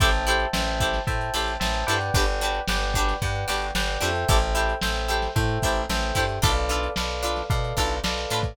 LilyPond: <<
  \new Staff \with { instrumentName = "Pizzicato Strings" } { \time 4/4 \key a \minor \tempo 4 = 112 <e' g' a' c''>8 <e' g' a' c''>4 <e' g' a' c''>4 <e' g' a' c''>4 <e' g' a' c''>8 | <d' fis' g' b'>8 <d' fis' g' b'>4 <d' fis' g' b'>4 <d' fis' g' b'>4 <d' fis' g' b'>8 | <e' g' a' c''>8 <e' g' a' c''>4 <e' g' a' c''>4 <e' g' a' c''>4 <e' g' a' c''>8 | <d' f' a' b'>8 <d' f' a' b'>4 <d' f' a' b'>4 <d' f' a' b'>4 <d' f' a' b'>8 | }
  \new Staff \with { instrumentName = "Electric Piano 2" } { \time 4/4 \key a \minor <c'' e'' g'' a''>4 <c'' e'' g'' a''>4 <c'' e'' g'' a''>4 <c'' e'' g'' a''>8 <b' d'' fis'' g''>8~ | <b' d'' fis'' g''>4 <b' d'' fis'' g''>4 <b' d'' fis'' g''>4 <b' d'' fis'' g''>8 <a' c'' e'' g''>8~ | <a' c'' e'' g''>4 <a' c'' e'' g''>4 <a' c'' e'' g''>4 <a' c'' e'' g''>4 | <a' b' d'' f''>4 <a' b' d'' f''>4 <a' b' d'' f''>4 <a' b' d'' f''>4 | }
  \new Staff \with { instrumentName = "Electric Bass (finger)" } { \clef bass \time 4/4 \key a \minor a,,4 a,,4 a,8 a,,8 a,,8 g,8 | g,,4 g,,4 g,8 g,,8 g,,8 f,8 | a,,4 a,,4 a,8 a,,8 a,,8 g,8 | b,,4 b,,4 b,8 b,,8 b,,8 a,8 | }
  \new DrumStaff \with { instrumentName = "Drums" } \drummode { \time 4/4 <hh bd>16 hh16 hh16 hh16 sn16 hh16 <hh bd>16 <hh sn>16 <hh bd>16 hh16 hh16 hh16 sn16 hh16 <hh sn>16 hh16 | <hh bd>16 hh16 hh16 hh16 sn16 hh16 <hh bd>16 <hh sn>16 <hh bd>16 hh16 hh16 hh16 sn16 hh16 hh16 hh16 | <hh bd>16 hh16 hh16 hh16 sn16 hh16 hh16 <hh sn>16 <hh bd>16 hh16 <hh bd>16 hh16 sn16 <hh sn>16 <hh bd sn>16 hh16 | <hh bd>16 hh16 hh16 hh16 sn16 hh16 hh16 <hh sn>16 <hh bd>16 hh16 <hh bd>16 hh16 sn16 hh16 hh16 <hh bd sn>16 | }
>>